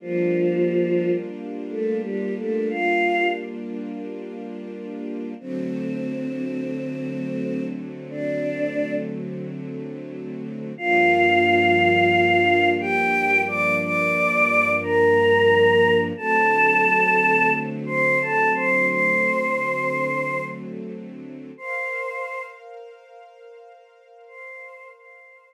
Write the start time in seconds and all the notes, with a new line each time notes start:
0.00 F3 G3 A#3 D4 F4
1.70 A3 A4
2.02 G3 G4
2.37 A3 A4
2.70 F4 F5
5.39 D3 F#3 A3 C4 C5
8.10 D4 D5
10.78 G2 F3 A#3 D4 F4 F5
12.80 G4 G5
13.47 D5 D6
13.82 D5 D6
14.83 A#4 A#5
16.17 D3 F#3 A3 C4 A4 A5
17.86 C5 C6
18.21 A4 A5
18.54 C5 C6
18.88 C5 C6
21.57 A#4 C5 F5 C6
24.27 C5 C6
24.95 C5 C6